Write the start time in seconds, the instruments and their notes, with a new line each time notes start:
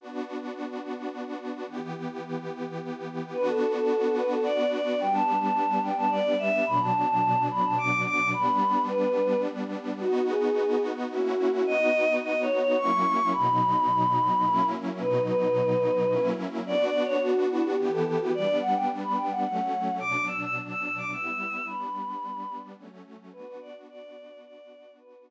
0.01 pad 2 (warm) B3 D4 F#4
1.67 pad 2 (warm) E3 B3 G4
3.33 pad 2 (warm) B3 D4 F#4, choir aahs B4
3.48 choir aahs A4
3.75 choir aahs A4
4.17 choir aahs B4
4.31 choir aahs A4
4.44 choir aahs D5
4.72 choir aahs D5
5.00 pad 2 (warm) G3 B3 D4, choir aahs G5
5.13 choir aahs A5
5.41 choir aahs A5
5.83 choir aahs G5
5.97 choir aahs A5
6.11 choir aahs D5
6.39 choir aahs E5
6.66 pad 2 (warm) B2 F#3 D4, choir aahs B5
6.81 choir aahs A5
7.08 choir aahs A5
7.51 choir aahs B5
7.64 choir aahs A5
7.78 choir aahs D6
8.06 choir aahs D6
8.33 pad 2 (warm) G3 B3 D4, choir aahs B5
8.88 choir aahs B4
10.00 pad 2 (warm) B3 D#4 F#4, choir aahs F#4
10.29 choir aahs G#4
11.11 pad 2 (warm) A#3 C#4 E4 F#4, choir aahs F#4
11.52 choir aahs F#4
11.66 pad 2 (warm) B3 D#4 F#4, choir aahs D#5
12.22 choir aahs D#5
12.42 choir aahs C#5
12.59 choir aahs C#5
12.78 pad 2 (warm) F#3 A#3 C#4 E4, choir aahs C#6
13.32 pad 2 (warm) B2 F#3 D#4, choir aahs B5
14.44 pad 2 (warm) F#3 A#3 C#4 E4
15.00 pad 2 (warm) B2 F#3 D#4, choir aahs B4
15.27 choir aahs B4
16.10 pad 2 (warm) F#3 A#3 C#4 E4
16.66 pad 2 (warm) B3 D4 F#4, choir aahs D5
16.85 choir aahs D5
17.04 choir aahs C#5
17.23 choir aahs F#4
17.51 choir aahs E4
17.64 choir aahs G4
17.78 pad 2 (warm) E3 B3 G4
17.92 choir aahs A4
18.05 choir aahs A4
18.20 choir aahs F#4
18.34 pad 2 (warm) G3 B3 D4, choir aahs D5
18.61 choir aahs F#5
18.75 choir aahs G5
19.03 choir aahs B5
19.17 choir aahs G5
19.31 choir aahs F#5
19.44 pad 2 (warm) F#3 A3 C#4, choir aahs F#5
20.00 pad 2 (warm) B2 F#3 D4, choir aahs D6
20.27 choir aahs E6
20.42 choir aahs E6
20.69 choir aahs E6
20.83 choir aahs E6
20.97 choir aahs D6
21.11 pad 2 (warm) G3 B3 E4, choir aahs E6
21.66 pad 2 (warm) G3 B3 D4, choir aahs B5
22.77 pad 2 (warm) F#3 A3 C#4
23.32 pad 2 (warm) B3 D4 F#4, choir aahs B4
23.47 choir aahs B4
23.61 choir aahs D5
23.89 choir aahs D5
24.44 choir aahs D5
24.99 pad 2 (warm) B3 D4 F#4, choir aahs B4